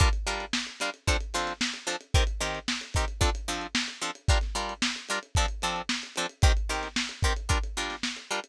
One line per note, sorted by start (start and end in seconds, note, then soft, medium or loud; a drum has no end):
0.00 0.09 G3 medium
0.00 0.09 D4 medium
0.00 0.09 F4 medium
0.00 0.09 A#4 medium
0.00 kick loud
0.00 closed hi-hat loud
0.13 closed hi-hat medium
0.27 0.45 G3 medium
0.27 0.45 D4 medium
0.27 0.45 F4 medium
0.27 0.45 A#4 medium
0.27 closed hi-hat medium
0.40 closed hi-hat medium
0.53 snare loud
0.67 closed hi-hat medium
0.80 0.90 G3 medium
0.80 0.90 D4 medium
0.80 0.90 F4 medium
0.80 0.90 A#4 medium
0.80 snare soft
0.80 closed hi-hat medium
0.94 closed hi-hat medium
1.07 1.17 F3 medium
1.07 1.17 C4 medium
1.07 1.17 D4 medium
1.07 1.17 A4 medium
1.07 kick medium
1.07 closed hi-hat loud
1.21 closed hi-hat medium
1.34 1.53 F3 medium
1.34 1.53 C4 medium
1.34 1.53 D4 medium
1.34 1.53 A4 medium
1.34 closed hi-hat medium
1.47 snare soft
1.47 closed hi-hat medium
1.61 snare loud
1.74 closed hi-hat medium
1.87 1.96 F3 medium
1.87 1.96 C4 medium
1.87 1.96 D4 medium
1.87 1.96 A4 medium
1.87 closed hi-hat medium
2.01 closed hi-hat medium
2.14 2.24 D#3 medium
2.14 2.24 C4 medium
2.14 2.24 G4 medium
2.14 2.24 A#4 medium
2.14 kick loud
2.14 closed hi-hat loud
2.27 closed hi-hat medium
2.41 2.59 D#3 medium
2.41 2.59 C4 medium
2.41 2.59 G4 medium
2.41 2.59 A#4 medium
2.41 snare soft
2.41 closed hi-hat medium
2.55 closed hi-hat medium
2.68 snare loud
2.81 closed hi-hat medium
2.94 3.05 D#3 medium
2.94 3.05 C4 medium
2.94 3.05 G4 medium
2.94 3.05 A#4 medium
2.94 kick medium
2.94 closed hi-hat medium
3.08 closed hi-hat medium
3.21 3.30 F3 medium
3.21 3.30 C4 medium
3.21 3.30 D4 medium
3.21 3.30 A4 medium
3.21 kick medium
3.21 closed hi-hat loud
3.35 closed hi-hat medium
3.48 3.67 F3 medium
3.48 3.67 C4 medium
3.48 3.67 D4 medium
3.48 3.67 A4 medium
3.48 closed hi-hat medium
3.61 closed hi-hat medium
3.75 snare loud
3.88 closed hi-hat medium
4.01 4.11 F3 medium
4.01 4.11 C4 medium
4.01 4.11 D4 medium
4.01 4.11 A4 medium
4.01 closed hi-hat medium
4.15 closed hi-hat medium
4.28 4.38 G3 medium
4.28 4.38 D4 medium
4.28 4.38 F4 medium
4.28 4.38 A#4 medium
4.28 kick loud
4.28 closed hi-hat loud
4.41 snare soft
4.41 closed hi-hat medium
4.55 4.74 G3 medium
4.55 4.74 D4 medium
4.55 4.74 F4 medium
4.55 4.74 A#4 medium
4.55 closed hi-hat medium
4.69 closed hi-hat medium
4.82 snare loud
4.96 closed hi-hat medium
5.09 5.19 G3 medium
5.09 5.19 D4 medium
5.09 5.19 F4 medium
5.09 5.19 A#4 medium
5.09 closed hi-hat medium
5.23 closed hi-hat medium
5.35 5.46 F3 medium
5.35 5.46 C4 medium
5.35 5.46 D4 medium
5.35 5.46 A4 medium
5.35 kick medium
5.35 closed hi-hat medium
5.48 closed hi-hat medium
5.62 5.82 F3 medium
5.62 5.82 C4 medium
5.62 5.82 D4 medium
5.62 5.82 A4 medium
5.62 closed hi-hat medium
5.76 closed hi-hat medium
5.89 snare loud
6.03 closed hi-hat medium
6.16 6.27 F3 medium
6.16 6.27 C4 medium
6.16 6.27 D4 medium
6.16 6.27 A4 medium
6.16 closed hi-hat medium
6.29 closed hi-hat medium
6.42 6.52 D#3 medium
6.42 6.52 C4 medium
6.42 6.52 G4 medium
6.42 6.52 A#4 medium
6.42 kick loud
6.42 closed hi-hat loud
6.57 closed hi-hat medium
6.69 6.88 D#3 medium
6.69 6.88 C4 medium
6.69 6.88 G4 medium
6.69 6.88 A#4 medium
6.69 closed hi-hat medium
6.83 snare soft
6.83 closed hi-hat medium
6.96 snare loud
7.09 closed hi-hat medium
7.23 7.33 D#3 medium
7.23 7.33 C4 medium
7.23 7.33 G4 medium
7.23 7.33 A#4 medium
7.23 kick medium
7.23 closed hi-hat medium
7.36 closed hi-hat medium
7.49 7.58 G3 medium
7.49 7.58 D4 medium
7.49 7.58 F4 medium
7.49 7.58 A#4 medium
7.49 kick medium
7.49 closed hi-hat medium
7.64 closed hi-hat medium
7.77 7.96 G3 medium
7.77 7.96 D4 medium
7.77 7.96 F4 medium
7.77 7.96 A#4 medium
7.77 snare soft
7.77 closed hi-hat medium
7.90 snare soft
7.90 closed hi-hat medium
8.03 snare loud
8.17 closed hi-hat medium
8.31 8.40 G3 medium
8.31 8.40 D4 medium
8.31 8.40 F4 medium
8.31 8.40 A#4 medium
8.44 closed hi-hat medium